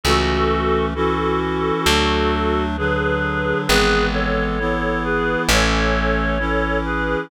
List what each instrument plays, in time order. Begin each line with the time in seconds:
0.04 electric bass (finger) C#2, clarinet E3 A3 C#4 F#4 A4
0.94 clarinet E3 C#4 E4 F#4 A4
1.86 electric bass (finger) D2, clarinet F#3 A3 D4
2.77 clarinet D3 F#3 D4 G#4 B4
3.67 electric bass (finger) G#1, clarinet E3 G#3 B3 G#4 B4
4.12 clarinet A4 C#5
4.59 clarinet E3 B3 E4
5.04 clarinet G#4 B4
5.48 electric bass (finger) A1, clarinet E3 A3 C#4 A4 C#5
6.39 clarinet E3 C#4 E4
6.85 clarinet G#4 B4